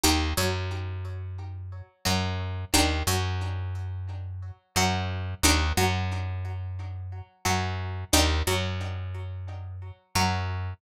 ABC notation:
X:1
M:4/4
L:1/8
Q:"Swing 16ths" 1/4=89
K:Ebmix
V:1 name="Pizzicato Strings"
[EGB] _G,5 G,2 | [=DEGB] _G,5 G,2 | [=DEGB] _G,5 G,2 | [=DEGB] _G,5 G,2 |]
V:2 name="Electric Bass (finger)" clef=bass
E,, _G,,5 G,,2 | E,, _G,,5 G,,2 | E,, _G,,5 G,,2 | E,, _G,,5 G,,2 |]